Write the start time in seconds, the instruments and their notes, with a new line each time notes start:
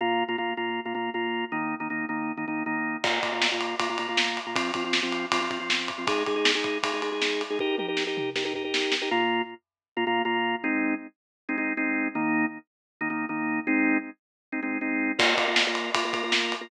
0.01 drawbar organ A#2 A#3 F4
0.28 drawbar organ A#2 A#3 F4
0.38 drawbar organ A#2 A#3 F4
0.57 drawbar organ A#2 A#3 F4
0.85 drawbar organ A#2 A#3 F4
0.95 drawbar organ A#2 A#3 F4
1.14 drawbar organ A#2 A#3 F4
1.52 drawbar organ D#3 A#3 D#4
1.80 drawbar organ D#3 A#3 D#4
1.90 drawbar organ D#3 A#3 D#4
2.09 drawbar organ D#3 A#3 D#4
2.37 drawbar organ D#3 A#3 D#4
2.48 drawbar organ D#3 A#3 D#4
2.66 drawbar organ D#3 A#3 D#4
3.04 drawbar organ A#2 A#3 F4, kick, crash
3.23 drawbar organ A#2 A#3 F4, kick, ride
3.32 drawbar organ A#2 A#3 F4
3.42 snare
3.52 drawbar organ A#2 A#3 F4
3.61 ride
3.80 drawbar organ A#2 A#3 F4, kick, ride
3.89 drawbar organ A#2 A#3 F4
3.98 drawbar organ A#2 A#3 F4, ride
4.08 drawbar organ A#2 A#3 F4
4.17 snare
4.37 ride
4.46 drawbar organ A#2 A#3 F4
4.56 drawbar organ F3 C4 F4, kick, ride
4.74 drawbar organ F3 C4 F4, kick, ride
4.84 drawbar organ F3 C4 F4
4.93 snare
5.02 drawbar organ F3 C4 F4
5.12 ride
5.32 drawbar organ F3 C4 F4, kick, ride
5.41 drawbar organ F3 C4 F4
5.50 drawbar organ F3 C4 F4, kick, ride
5.60 drawbar organ F3 C4 F4
5.70 snare
5.88 kick, ride
5.98 drawbar organ F3 C4 F4
6.07 drawbar organ G#3 D#4 G#4, kick, ride
6.26 drawbar organ G#3 D#4 G#4, kick, ride
6.36 drawbar organ G#3 D#4 G#4
6.45 snare
6.55 drawbar organ G#3 D#4 G#4
6.64 kick, ride
6.83 drawbar organ G#3 D#4 G#4, kick, ride
6.93 drawbar organ G#3 D#4 G#4
7.02 drawbar organ G#3 D#4 G#4, ride
7.12 drawbar organ G#3 D#4 G#4
7.22 snare
7.41 ride
7.50 drawbar organ G#3 D#4 G#4
7.59 drawbar organ D#4 G4 A#4, kick
7.78 drawbar organ D#4 G4 A#4, high tom
7.88 drawbar organ D#4 G4 A#4
7.97 snare
8.07 drawbar organ D#4 G4 A#4
8.17 mid tom
8.36 drawbar organ D#4 G4 A#4, snare
8.45 drawbar organ D#4 G4 A#4
8.54 drawbar organ D#4 G4 A#4, floor tom
8.64 drawbar organ D#4 G4 A#4
8.74 snare
8.92 snare
9.02 drawbar organ D#4 G4 A#4
9.11 drawbar organ A#2 A#3 F4
9.97 drawbar organ A#2 A#3 F4
10.07 drawbar organ A#2 A#3 F4
10.25 drawbar organ A#2 A#3 F4
10.64 drawbar organ G#3 C4 D#4
11.49 drawbar organ G#3 C4 D#4
11.58 drawbar organ G#3 C4 D#4
11.77 drawbar organ G#3 C4 D#4
12.15 drawbar organ D#3 A#3 D#4
13.01 drawbar organ D#3 A#3 D#4
13.10 drawbar organ D#3 A#3 D#4
13.29 drawbar organ D#3 A#3 D#4
13.67 drawbar organ G#3 C4 D#4
14.52 drawbar organ G#3 C4 D#4
14.63 drawbar organ G#3 C4 D#4
14.81 drawbar organ G#3 C4 D#4
15.19 drawbar organ A#3 F4 A#4, kick, crash
15.37 drawbar organ A#3 F4 A#4, kick, ride
15.48 drawbar organ A#3 F4 A#4
15.56 snare
15.67 drawbar organ A#3 F4 A#4
15.75 ride
15.95 drawbar organ A#3 F4 A#4, kick, ride
16.05 drawbar organ A#3 F4 A#4
16.13 drawbar organ A#3 F4 A#4, kick, ride
16.23 drawbar organ A#3 F4 A#4
16.32 snare
16.52 ride
16.61 drawbar organ A#3 F4 A#4